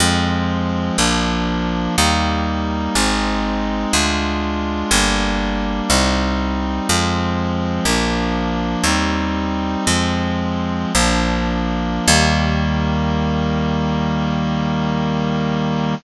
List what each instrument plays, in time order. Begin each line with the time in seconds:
0.00 electric bass (finger) F2, clarinet F3 G#3 C4
0.98 electric bass (finger) A#1, clarinet F3 A#3 D4
1.98 electric bass (finger) D#2, clarinet G3 A#3 D#4
2.95 electric bass (finger) G#1, clarinet G#3 C4 D#4
3.93 electric bass (finger) D2, clarinet G#3 D4 F4
4.91 electric bass (finger) G1, clarinet G3 A#3 D4
5.90 electric bass (finger) C2, clarinet G3 C4 D#4
6.88 electric bass (finger) F2, clarinet F3 G#3 C4
7.85 electric bass (finger) A#1, clarinet F3 A#3 D4
8.84 electric bass (finger) D#2, clarinet G3 C4 D#4
9.86 electric bass (finger) F2, clarinet F3 G#3 C4
10.95 electric bass (finger) A#1, clarinet F3 A#3 D4
12.08 electric bass (finger) D#2, clarinet D#3 G3 A#3